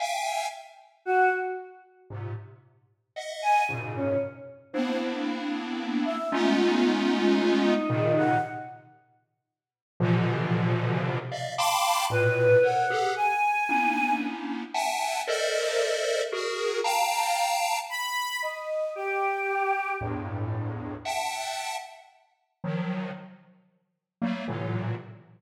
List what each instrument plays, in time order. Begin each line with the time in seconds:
0.00 lead 1 (square) E5 F5 G5 G#5
1.05 choir aahs F#4
2.10 lead 1 (square) G#2 A#2 C3
3.16 lead 1 (square) D#5 E5 F#5
3.42 choir aahs G#5
3.69 lead 1 (square) F#2 G#2 A#2 B2 C#3
3.95 choir aahs C#4
4.73 lead 1 (square) A#3 B3 C4 D4 E4, choir aahs C5
6.05 choir aahs E5
6.32 lead 1 (square) G#3 A3 B3 C#4 D#4 F4
7.64 choir aahs D#4
7.89 lead 1 (square) A#2 C3 C#3 D#3
8.17 choir aahs F#5
10.00 lead 1 (square) A#2 B2 C3 D3 E3 F3
11.31 lead 1 (square) D5 D#5 E5 F5
11.58 lead 1 (square) F5 G5 A5 B5 C6 D6
12.10 lead 1 (square) A2 A#2 B2, choir aahs B4
12.63 lead 1 (square) A4 A#4 C5 C#5, choir aahs F#5
12.90 lead 1 (square) G4 G#4 A4
13.16 choir aahs G#5
13.69 lead 1 (square) A#3 B3 C#4 D4 D#4 E4
14.74 lead 1 (square) E5 F#5 G5 G#5 A5
15.27 lead 1 (square) A4 A#4 C5 D5 D#5 E5
16.32 lead 1 (square) F#4 G#4 A#4
16.84 lead 1 (square) F5 G5 A5 A#5
17.89 choir aahs B5
18.42 choir aahs D#5
18.95 choir aahs G4
20.01 lead 1 (square) E2 F2 G2 A2
21.05 lead 1 (square) E5 F#5 G5 A5
22.64 lead 1 (square) D#3 F3 F#3
24.21 lead 1 (square) F#3 G3 A3 A#3
24.48 lead 1 (square) A2 A#2 C3 D3 E3 F#3